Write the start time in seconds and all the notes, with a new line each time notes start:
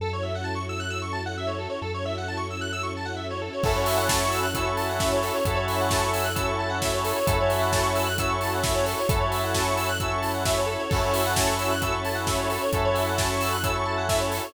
0.00 F#2 C#4 E4 F#4 A4
0.13 C#5
0.23 E5
0.35 F#5
0.44 A5
0.55 C#6
0.69 E6
0.80 F#6
0.90 E6
1.02 C#6
1.13 A5
1.26 F#5
1.37 E5
1.47 C#5
1.58 A4
1.70 C#5
1.82 F#2 C#4 E4 F#4 A4
1.94 C#5
2.05 E5
2.18 F#5
2.28 A5
2.37 C#6
2.50 E6
2.61 F#6
2.73 E6
2.83 C#6
2.97 A5
3.05 F#5
3.16 E5
3.30 C#5
3.42 A4
3.53 C#5
3.63 F#2 C#4 E4 F#4 A4, kick, crash
3.76 C#5
3.86 E5, open hi-hat
3.97 F#5
4.09 A5, kick, snare
4.22 C#6
4.30 E6, open hi-hat
4.43 F#6
4.54 C#4 E4 F#4 A4 E6, kick, closed hi-hat
4.66 C#6
4.77 A5, open hi-hat
4.89 F#5
4.99 E5, kick, snare
5.12 C#5
5.22 A4, open hi-hat
5.33 C#5
5.45 F#2 C#4 E4 F#4 A4, kick, closed hi-hat
5.55 C#5
5.67 E5, open hi-hat
5.81 F#5
5.91 A5, kick, snare
6.01 C#6
6.14 E6, open hi-hat
6.24 F#6
6.35 C#4 E4 F#4 A4 E6, kick, closed hi-hat
6.47 C#6
6.59 A5
6.70 F#5
6.82 E5, kick, snare
6.93 C#5
7.04 A4, open hi-hat
7.16 C#5
7.26 F#2 C#4 E4 F#4 A4, kick, closed hi-hat
7.40 C#5
7.50 E5, open hi-hat
7.61 F#5
7.71 A5, kick, snare
7.83 C#6
7.95 E6, open hi-hat
8.06 F#6
8.18 C#4 E4 F#4 A4 E6, kick, closed hi-hat
8.29 C#6
8.41 A5, open hi-hat
8.54 F#5
8.63 E5, kick, snare
8.74 C#5
8.85 A4, open hi-hat
8.99 C#5
9.09 F#2 C#4 E4 F#4 A4, kick, closed hi-hat
9.20 C#5
9.31 E5, open hi-hat
9.44 F#5
9.54 A5, kick, snare
9.65 C#6
9.77 E6, open hi-hat
9.88 F#6
10.00 C#4 E4 F#4 A4 E6, kick, closed hi-hat
10.11 C#6
10.22 A5, open hi-hat
10.34 F#5
10.45 E5, kick, snare
10.58 C#5
10.66 A4
10.79 C#5
10.90 F#2 C#4 E4 F#4 A4, kick, crash
11.03 C#5
11.14 E5, open hi-hat
11.26 F#5
11.36 A5, kick, snare
11.47 C#6
11.59 E6, open hi-hat
11.71 F#6
11.81 C#4 E4 F#4 A4 E6, kick, closed hi-hat
11.92 C#6
12.05 A5, open hi-hat
12.15 F#5
12.27 E5, kick, snare
12.38 C#5
12.50 A4, open hi-hat
12.62 C#5
12.72 F#2 C#4 E4 F#4 A4, kick, closed hi-hat
12.85 C#5
12.94 E5, open hi-hat
13.07 F#5
13.18 A5, kick, snare
13.30 C#6
13.41 E6, open hi-hat
13.53 F#6
13.63 C#4 E4 F#4 A4 E6, kick, closed hi-hat
13.75 C#6
13.85 A5
13.98 F#5
14.09 E5, kick, snare
14.20 C#5
14.32 A4, open hi-hat
14.44 C#5